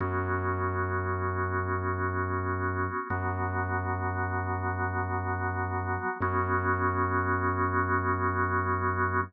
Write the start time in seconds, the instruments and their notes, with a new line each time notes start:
0.00 synth bass 2 F#2, drawbar organ B3 C#4 F#4
3.10 synth bass 2 F#2, drawbar organ F#3 B3 F#4
6.20 synth bass 2 F#2, drawbar organ B3 C#4 F#4